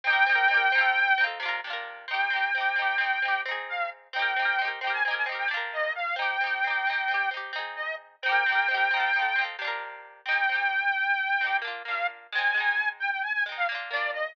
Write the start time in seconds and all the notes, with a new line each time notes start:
0.04 C4 D#4 G5
0.10 G4 A#4
0.26 C4 D#4
0.32 G4 A#4
0.48 C4 D#4
0.54 G4 A#4
0.72 C4 D#4
0.78 F4 A4
1.18 C4 D#4
1.24 F4 A4
1.40 C3 D4
1.46 F4 A#4
1.64 C3 D4
1.70 F4 A#4
2.08 C4 D#4 G5
2.14 G4
2.30 C4 D#4
2.36 G4
2.55 C4 D#4
2.61 G4
2.76 C4 D#4
2.82 G4
2.98 C4 D#4
3.04 G4
3.22 C4 D#4
3.28 G4
3.45 C4 D#4
3.51 G#4
3.69 F5
4.13 C4 D#4 G5
4.19 G4 A#4
4.36 C4 D#4
4.42 G4 A#4
4.59 C4 D#4
4.65 G4 A#4
4.81 C4 D#4 G5
4.87 G4 A#4
4.93 G#5
5.03 C4 G#5
5.08 D#4 G4
5.14 A#4 G#5
5.26 C4 D#4
5.32 G4 A#4
5.38 G5
5.48 C3 D4
5.54 F4 A#4
5.73 D#5
5.95 F5
6.16 C4 D#4 G5
6.22 G4
6.41 C4 D#4
6.47 G4
6.64 C4 D#4
6.70 G4
6.87 C4 D#4
6.93 G4
7.08 C4 D#4
7.14 G4
7.31 C4 D#4
7.37 G4
7.53 C4 D#4
7.59 G#4
7.76 D#5
8.22 C4 D#4 G5
8.29 G4 A#4
8.46 C4 D#4
8.52 G4 A#4
8.68 C4 D#4
8.74 G4 A#4
8.91 C4 D#4
8.97 F4 A4
9.13 C4 D#4
9.19 F4 A4
9.36 C4 D#4
9.41 F4 A4
9.59 C3 D4
9.65 F4 A#4
10.25 C4 D#4 G5
10.32 G4
10.49 C4 D#4
10.55 G4
11.41 C4 D#4
11.47 G4
11.62 A#3 D4
11.68 F4
11.85 A#3 D4 F5
11.91 F4
12.32 G#3 C4 G#5
12.38 D#4
12.54 G#3 C4
12.60 D#4
12.99 G5
13.11 G5
13.23 G#5
13.33 G#5
13.46 G#3 C4
13.52 D#4
13.57 F5
13.69 A#3 D4
13.75 F4
13.91 A#3 D4 D5
13.96 F4
14.13 D#5